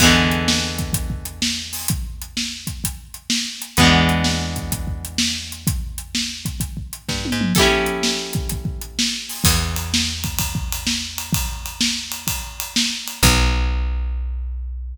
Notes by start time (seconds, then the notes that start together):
0.00 E2 E3 G#3 B3, kick, crash
0.05 D3
0.31 closed hi-hat
0.48 snare
0.78 kick, closed hi-hat
0.93 kick, closed hi-hat
1.10 kick
1.25 closed hi-hat
1.42 snare
1.73 open hi-hat
1.88 kick, closed hi-hat
2.22 closed hi-hat
2.37 snare
2.67 kick, closed hi-hat
2.84 kick, closed hi-hat
3.14 closed hi-hat
3.30 snare
3.62 closed hi-hat
3.77 E2 G#3 B3, kick, closed hi-hat
3.81 D3 E3
4.09 closed hi-hat
4.24 snare
4.56 kick, closed hi-hat
4.72 kick, closed hi-hat
4.87 kick
5.05 closed hi-hat
5.18 snare
5.52 closed hi-hat
5.67 kick, closed hi-hat
5.98 closed hi-hat
6.15 snare
6.45 kick, closed hi-hat
6.60 kick, closed hi-hat
6.77 kick
6.93 closed hi-hat
7.09 G2, kick, snare
7.25 high tom
7.32 G#2
7.41 mid tom
7.55 G4 A4, kick, crash
7.59 C#4 E4
7.86 closed hi-hat
8.03 snare
8.33 kick, closed hi-hat
8.49 kick, closed hi-hat
8.65 kick
8.81 closed hi-hat
8.99 snare
9.29 open hi-hat
9.44 E2, kick, crash
9.76 ride
9.94 snare
10.24 kick, ride
10.39 kick, ride
10.55 kick
10.72 ride
10.87 snare
11.18 ride
11.33 kick, ride
11.66 ride
11.81 snare
12.12 ride
12.27 kick, ride
12.60 ride
12.76 snare
13.08 ride
13.23 B1, kick, crash